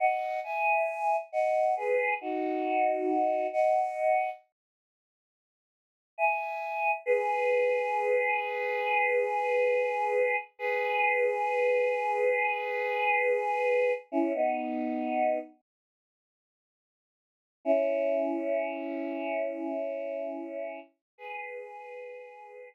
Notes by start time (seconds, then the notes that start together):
0.00 D#5 F#5
0.44 E5 G#5
1.32 D#5 F#5
1.76 G#4 B4
2.21 D#4 F#4
3.53 D#5 F#5
6.18 E5 G#5
7.06 G#4 B4
10.59 G#4 B4
14.12 C#4 E4
14.34 B3 D#4
17.65 C#4 E4
21.18 G#4 B4